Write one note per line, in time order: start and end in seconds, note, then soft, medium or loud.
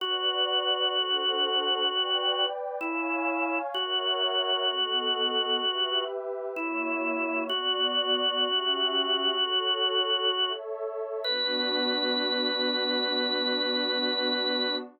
0.00 2.46 F#4 loud
0.00 0.93 B4 medium
0.00 0.93 D5 medium
0.00 0.92 F#5 medium
0.92 1.85 D4 medium
0.92 1.85 A4 medium
0.92 1.85 C5 medium
0.92 1.85 F#5 medium
1.87 2.80 B4 medium
1.87 2.80 D5 medium
1.87 2.80 G5 medium
2.81 3.59 E4 loud
2.81 3.74 C#5 medium
2.81 3.74 F5 medium
2.81 3.74 G#5 medium
3.74 6.04 F#4 loud
3.74 4.68 A#4 medium
3.74 4.68 C#5 medium
3.74 4.68 E5 medium
3.74 4.68 F#5 medium
4.68 5.61 B3 medium
4.68 5.61 A4 medium
4.68 5.61 D#5 medium
4.68 5.61 F#5 medium
5.61 6.54 G4 medium
5.61 6.54 B4 medium
5.61 6.54 E5 medium
6.55 7.48 A#3 medium
6.55 7.44 E4 loud
6.55 7.48 F#4 medium
6.55 7.48 C#5 medium
6.55 7.48 E5 medium
7.49 8.44 B3 medium
7.49 10.53 F#4 loud
7.49 8.44 F#4 medium
7.49 8.44 D5 medium
8.43 9.36 C#4 medium
8.43 9.36 G4 medium
8.43 9.36 E5 medium
9.37 10.30 F#4 medium
9.37 10.30 A4 medium
9.37 10.30 C#5 medium
10.32 11.24 A4 medium
10.32 11.24 C#5 medium
10.32 11.24 E5 medium
11.24 14.78 B3 loud
11.24 14.78 D4 loud
11.24 14.78 F#4 loud
11.24 14.76 B4 loud